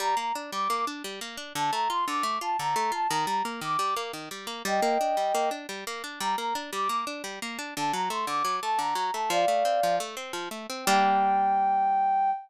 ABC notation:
X:1
M:9/8
L:1/8
Q:3/8=116
K:Gm
V:1 name="Ocarina"
b b z d'2 z4 | a b c' d'2 a b2 a | b b z d'2 z4 | [eg]5 z4 |
b b z d'2 z4 | a b c' d'2 a b2 a | [df]4 z5 | g9 |]
V:2 name="Acoustic Guitar (steel)"
G, B, D G, B, D G, B, D | D, A, F D, A, F D, A, F | E, G, B, E, G, B, E, G, B, | G, B, D G, B, D G, B, D |
G, B, D G, B, D G, B, D | D, ^F, A, D, F, A, D, F, A, | F, A, C F, A, C F, A, C | [G,B,D]9 |]